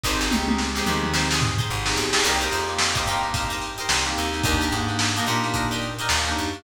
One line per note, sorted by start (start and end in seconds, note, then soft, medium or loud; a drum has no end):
0.04 0.29 G#1 loud
0.04 0.27 C4 medium
0.04 0.27 D#4 loud
0.04 0.18 D#4 loud
0.04 0.27 G4 medium
0.04 0.18 G4 loud
0.04 0.27 G#4 medium
0.04 0.18 G#4 loud
0.04 0.18 C5 loud
0.04 kick medium
0.04 snare medium
0.21 0.62 D#4 medium
0.21 0.62 G4 medium
0.21 0.62 G#4 medium
0.21 0.62 C5 medium
0.21 snare medium
0.31 0.81 C#2 medium
0.31 0.45 C4 medium
0.31 0.45 D#4 medium
0.31 0.45 G4 medium
0.31 0.45 G#4 medium
0.31 high tom medium
0.48 0.69 C4 medium
0.48 0.69 D#4 medium
0.48 0.69 G4 medium
0.48 0.69 G#4 medium
0.48 high tom medium
0.58 snare medium
0.75 0.83 C4 medium
0.75 0.83 D#4 medium
0.75 0.85 D#4 medium
0.75 0.83 G4 loud
0.75 0.85 G4 medium
0.75 0.83 G#4 medium
0.75 0.85 G#4 medium
0.75 snare medium
0.79 0.85 C5 medium
0.86 1.60 D#2 medium
0.86 1.00 C4 medium
0.86 1.00 D#4 medium
0.86 1.10 D#4 medium
0.86 1.00 G4 medium
0.86 1.10 G4 medium
0.86 1.00 G#4 medium
0.86 1.10 G#4 medium
0.86 1.10 C5 medium
0.86 mid tom medium
1.03 1.44 C4 medium
1.03 1.44 D#4 medium
1.03 1.44 G4 loud
1.03 1.44 G#4 medium
1.03 mid tom medium
1.14 1.27 D#4 medium
1.14 1.27 G4 medium
1.14 1.27 G#4 medium
1.14 1.27 C5 medium
1.14 snare loud
1.31 1.52 D#4 medium
1.31 1.52 G4 medium
1.31 1.52 G#4 medium
1.31 1.52 C5 medium
1.31 snare loud
1.41 floor tom medium
1.58 2.00 D#4 medium
1.58 2.00 G4 medium
1.58 2.00 G#4 medium
1.58 2.00 C5 medium
1.58 floor tom medium
1.70 1.95 G#1 medium
1.86 2.06 C4 medium
1.86 2.06 D#4 medium
1.86 2.06 G4 medium
1.86 2.06 G#4 medium
1.86 snare loud
1.96 2.21 B1 medium
1.96 snare medium
2.13 2.21 C4 medium
2.13 2.21 D#4 medium
2.13 2.21 G4 medium
2.13 2.21 G#4 medium
2.13 snare loud
2.24 2.49 C2 loud
2.24 2.47 A#3 loud
2.24 2.47 C4 loud
2.24 2.47 D#4 loud
2.24 2.38 D#4 medium
2.24 2.47 G4 loud
2.24 2.38 G4 medium
2.24 2.38 A#4 medium
2.24 2.38 C5 medium
2.24 crash loud
2.41 2.82 D#4 medium
2.41 2.82 G4 medium
2.41 2.82 A#4 medium
2.41 2.82 C5 medium
2.41 closed hi-hat medium
2.50 3.01 F2 medium
2.50 2.64 A#3 medium
2.50 2.64 C4 medium
2.50 2.64 D#4 medium
2.50 2.64 G4 medium
2.50 snare medium
2.50 closed hi-hat medium
2.68 2.89 A#3 medium
2.68 2.89 C4 medium
2.68 2.89 D#4 medium
2.68 2.89 G4 medium
2.68 closed hi-hat medium
2.79 snare loud
2.95 3.04 A#3 medium
2.95 3.04 C4 medium
2.95 3.03 D#4 medium
2.95 3.04 D#4 medium
2.95 3.04 G4 medium
2.95 3.03 G4 medium
2.95 3.03 A#4 medium
2.95 3.03 C5 medium
2.95 kick medium
2.95 closed hi-hat medium
3.06 3.80 G2 medium
3.06 3.20 A#3 medium
3.06 3.20 C4 medium
3.06 3.20 D#4 loud
3.06 3.31 D#4 medium
3.06 3.20 G4 medium
3.06 3.31 G4 medium
3.06 3.31 A#4 medium
3.06 closed hi-hat medium
3.10 3.31 C5 medium
3.23 3.64 A#3 medium
3.23 3.64 C4 medium
3.23 3.64 D#4 medium
3.23 3.64 G4 medium
3.23 closed hi-hat medium
3.34 3.48 D#4 medium
3.34 3.48 G4 medium
3.34 3.48 A#4 medium
3.34 3.48 C5 medium
3.34 kick medium
3.34 closed hi-hat loud
3.50 3.71 D#4 medium
3.50 3.71 G4 medium
3.50 3.71 A#4 medium
3.50 3.71 C5 medium
3.50 closed hi-hat medium
3.61 snare soft
3.61 closed hi-hat medium
3.78 4.19 D#4 medium
3.78 4.19 G4 medium
3.78 4.19 A#4 medium
3.78 4.19 C5 medium
3.78 closed hi-hat medium
3.89 4.14 C2 medium
3.89 snare loud
4.05 4.26 A#3 medium
4.05 4.26 C4 medium
4.05 4.26 D#4 medium
4.05 4.26 G4 medium
4.05 closed hi-hat medium
4.17 4.42 D#2 loud
4.17 snare soft
4.17 closed hi-hat medium
4.33 4.42 A#3 medium
4.33 4.42 C4 medium
4.33 4.42 D#4 medium
4.33 4.42 G4 medium
4.33 closed hi-hat medium
4.44 4.69 D#2 loud
4.44 4.67 A#3 medium
4.44 4.57 D4 medium
4.44 4.67 D4 medium
4.44 4.67 D#4 medium
4.44 4.57 D#4 loud
4.44 4.67 G4 loud
4.44 4.57 G4 medium
4.44 4.57 A#4 loud
4.44 kick loud
4.44 closed hi-hat loud
4.61 5.03 D4 medium
4.61 5.03 D#4 medium
4.61 5.03 G4 medium
4.61 5.03 A#4 medium
4.61 closed hi-hat medium
4.71 5.21 G#2 medium
4.71 4.85 A#3 medium
4.71 4.85 D4 medium
4.71 4.85 D#4 medium
4.71 4.85 G4 medium
4.71 snare medium
4.71 closed hi-hat medium
4.88 5.08 A#3 medium
4.88 5.08 D4 medium
4.88 5.08 D#4 medium
4.88 5.08 G4 medium
4.88 closed hi-hat medium
4.99 snare loud
5.16 5.24 A#3 loud
5.16 5.24 D4 medium
5.16 5.25 D4 medium
5.16 5.24 D#4 medium
5.16 5.25 D#4 medium
5.16 5.24 G4 medium
5.16 5.25 G4 medium
5.16 5.25 A#4 medium
5.16 closed hi-hat medium
5.26 6.01 A#2 loud
5.26 5.40 A#3 medium
5.26 5.40 D4 medium
5.26 5.50 D4 medium
5.26 5.40 D#4 medium
5.26 5.50 D#4 medium
5.26 5.40 G4 medium
5.26 5.50 G4 medium
5.26 5.50 A#4 medium
5.26 closed hi-hat medium
5.43 5.85 A#3 medium
5.43 5.85 D4 medium
5.43 5.85 D#4 medium
5.43 5.85 G4 medium
5.43 snare soft
5.43 closed hi-hat medium
5.54 5.67 D4 medium
5.54 5.67 D#4 medium
5.54 5.67 G4 medium
5.54 5.67 A#4 medium
5.54 kick medium
5.54 closed hi-hat loud
5.71 5.92 D4 medium
5.71 5.92 D#4 medium
5.71 5.92 G4 medium
5.71 5.92 A#4 medium
5.71 closed hi-hat medium
5.82 closed hi-hat medium
5.99 6.40 D4 medium
5.99 6.40 D#4 medium
5.99 6.40 G4 medium
5.99 6.40 A#4 medium
5.99 closed hi-hat medium
6.09 6.34 D#2 loud
6.09 snare loud
6.26 6.47 A#3 medium
6.26 6.47 D4 medium
6.26 6.47 D#4 medium
6.26 6.47 G4 medium
6.26 closed hi-hat medium
6.36 6.63 F#2 medium
6.36 closed hi-hat medium
6.53 6.62 A#3 medium
6.53 6.62 D4 medium
6.53 6.62 D#4 medium
6.53 6.62 G4 medium
6.53 closed hi-hat medium